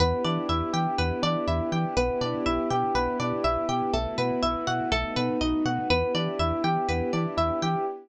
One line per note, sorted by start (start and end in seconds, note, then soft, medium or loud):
0.00 0.14 E2 medium
0.00 1.94 B3 medium
0.00 0.22 B3 medium
0.00 1.94 D4 medium
0.00 1.94 E4 medium
0.00 1.94 G4 medium
0.00 0.98 B4 loud
0.24 0.38 E3 medium
0.24 0.47 D4 medium
0.24 1.23 D5 medium
0.49 0.63 E2 medium
0.49 0.71 E4 medium
0.49 1.47 E5 medium
0.73 0.87 E3 medium
0.73 0.95 G4 medium
0.73 1.72 G5 medium
0.98 1.12 E2 medium
0.98 1.20 B3 medium
0.98 1.92 B4 medium
1.22 1.36 E3 medium
1.22 1.45 D4 medium
1.22 1.93 D5 medium
1.47 1.61 E2 medium
1.47 1.69 E4 medium
1.47 1.94 E5 medium
1.72 1.85 E3 medium
1.72 1.94 G4 medium
1.72 1.96 G5 medium
1.97 2.10 B1 loud
1.97 3.92 B3 medium
1.97 2.19 B3 medium
1.97 3.92 D4 medium
1.97 3.92 E4 medium
1.97 3.92 G4 medium
1.97 2.95 B4 loud
2.21 2.35 B2 medium
2.21 2.43 D4 medium
2.21 3.19 D5 medium
2.46 2.60 B1 medium
2.46 2.68 E4 medium
2.46 3.44 E5 medium
2.70 2.84 B2 medium
2.70 2.93 G4 medium
2.70 3.68 G5 medium
2.95 3.08 B1 medium
2.95 3.17 B3 medium
2.95 3.88 B4 medium
3.20 3.33 B2 medium
3.20 3.42 D4 medium
3.20 3.90 D5 medium
3.44 3.58 B1 medium
3.44 3.66 E4 medium
3.44 3.91 E5 medium
3.69 3.82 B2 medium
3.69 3.91 G4 medium
3.69 3.92 G5 medium
3.93 4.07 B1 medium
3.93 4.15 A3 medium
3.93 4.91 A3 medium
3.93 4.91 B3 medium
3.93 4.92 E4 medium
3.93 4.91 F#4 medium
3.93 4.87 A4 medium
4.18 4.31 B2 medium
4.18 4.40 B3 medium
4.18 4.88 B4 medium
4.42 4.56 B1 medium
4.42 4.64 E4 medium
4.42 4.89 E5 medium
4.67 4.81 B2 medium
4.67 4.89 F#4 medium
4.67 4.91 F#5 medium
4.91 5.05 B1 medium
4.91 5.89 A3 medium
4.91 5.14 A3 medium
4.91 5.89 B3 medium
4.91 5.89 D#4 medium
4.91 5.89 F#4 medium
4.91 5.85 A4 loud
5.16 5.30 B2 medium
5.16 5.38 B3 medium
5.16 5.86 B4 medium
5.41 5.55 B1 medium
5.41 5.63 D#4 medium
5.41 5.88 D#5 medium
5.65 5.79 B2 medium
5.65 5.87 F#4 medium
5.65 5.89 F#5 medium
5.90 6.04 E2 medium
5.90 7.85 B3 medium
5.90 6.12 B3 medium
5.90 7.85 D4 medium
5.90 7.85 E4 medium
5.90 7.85 G4 medium
5.90 6.88 B4 loud
6.15 6.28 E3 medium
6.15 6.37 D4 medium
6.15 7.12 D5 medium
6.39 6.53 E2 medium
6.39 6.62 E4 medium
6.39 7.37 E5 medium
6.64 6.77 E3 medium
6.64 6.86 G4 medium
6.64 7.62 G5 medium
6.89 7.02 E2 medium
6.89 7.11 B3 medium
6.89 7.82 B4 medium
7.13 7.27 E3 medium
7.13 7.36 D4 medium
7.13 7.83 D5 medium
7.37 7.51 E2 medium
7.37 7.59 E4 medium
7.37 7.84 E5 medium
7.62 7.76 E3 medium
7.62 7.85 G4 medium
7.62 7.86 G5 medium